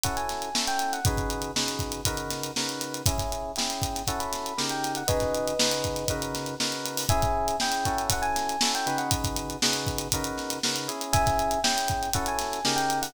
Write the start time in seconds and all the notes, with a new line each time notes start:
0.03 C#4 E4 F#4 A4 F#5, kick, closed hi-hat
0.17 G#5, closed hi-hat
0.29 snare, closed hi-hat
0.42 closed hi-hat
0.54 C#4 E4 F#4 A4, snare
0.67 G5, closed hi-hat
0.79 closed hi-hat
0.93 F#5, closed hi-hat
1.05 C#3 D#4 F#4 G#4 B4, kick, closed hi-hat
1.17 kick, closed hi-hat
1.30 closed hi-hat
1.42 closed hi-hat
1.56 C#3 D#4 F#4 G#4 B4, snare
1.68 snare, closed hi-hat
1.79 kick, closed hi-hat
1.92 closed hi-hat
2.05 C#3 D#4 F#4 A#4 B4, kick, closed hi-hat
2.17 closed hi-hat
2.30 snare, closed hi-hat
2.43 closed hi-hat
2.56 C#3 D#4 F#4 A#4 B4, snare
2.69 closed hi-hat
2.81 snare, closed hi-hat
2.94 closed hi-hat
3.06 C#4 E4 G#4 E5 G#5, kick, closed hi-hat
3.18 kick, snare, closed hi-hat
3.32 closed hi-hat
3.56 C#4 E4 G#4 G5, snare, closed hi-hat
3.70 closed hi-hat
3.82 kick, closed hi-hat
3.95 snare, closed hi-hat
4.07 C#4 E4 F#4 A4 F#5, kick, closed hi-hat
4.19 B5, closed hi-hat
4.33 snare, closed hi-hat
4.46 closed hi-hat
4.57 C#3 D#4 G4 A#4, snare
4.69 G5, closed hi-hat
4.83 snare, closed hi-hat
4.95 F#5, closed hi-hat
5.08 C#3 D#4 F#4 G#4 B4 D#5, kick, closed hi-hat
5.20 kick, snare, closed hi-hat
5.35 closed hi-hat
5.48 closed hi-hat
5.59 C#3 D#4 F#4 G#4 B4, snare
5.71 closed hi-hat
5.84 kick, closed hi-hat
5.96 snare, closed hi-hat
6.08 C#3 D#4 F#4 A#4 B4, kick, closed hi-hat
6.22 closed hi-hat
6.34 snare, closed hi-hat
6.46 closed hi-hat
6.60 C#3 D#4 F#4 A#4 B4, snare
6.72 closed hi-hat
6.86 closed hi-hat
6.97 open hi-hat
7.09 C#4 E4 G#4 E5 G#5, kick, closed hi-hat
7.22 kick, closed hi-hat
7.48 closed hi-hat
7.60 C#4 E4 G#4 G5, snare
7.72 closed hi-hat
7.85 C#4 E4 F#4 A4, kick, closed hi-hat
7.98 closed hi-hat
8.10 F#5, kick, closed hi-hat
8.22 G#5, closed hi-hat
8.36 snare, closed hi-hat
8.49 closed hi-hat
8.61 C#4 E4 F#4 A4, snare
8.75 G5, closed hi-hat
8.86 C#3 D#4 F#4 G#4 B4, closed hi-hat
8.98 F#5, closed hi-hat
9.11 kick, closed hi-hat
9.24 kick, closed hi-hat
9.36 closed hi-hat
9.50 closed hi-hat
9.62 C#3 D#4 F#4 G#4 B4, snare
9.73 closed hi-hat
9.87 kick, closed hi-hat
9.98 closed hi-hat
10.12 C#3 D#4 F#4 A#4 B4, kick, closed hi-hat
10.24 closed hi-hat
10.38 snare, closed hi-hat
10.50 snare, closed hi-hat
10.63 C#3 D#4 F#4 A#4 B4, snare
10.76 closed hi-hat
10.88 C#4 E4 G#4, closed hi-hat
11.01 closed hi-hat
11.13 E5 G#5, kick, closed hi-hat
11.26 kick, snare, closed hi-hat
11.39 closed hi-hat
11.51 closed hi-hat
11.64 C#4 E4 G#4 G5, snare
11.78 closed hi-hat
11.88 kick, closed hi-hat
12.03 closed hi-hat
12.13 C#4 E4 F#4 A4 F#5, kick, closed hi-hat
12.26 G#5, closed hi-hat
12.39 snare, closed hi-hat
12.52 snare, closed hi-hat
12.65 C#3 D#4 G4 A#4, snare
12.76 G5, closed hi-hat
12.90 closed hi-hat
13.02 F#5, open hi-hat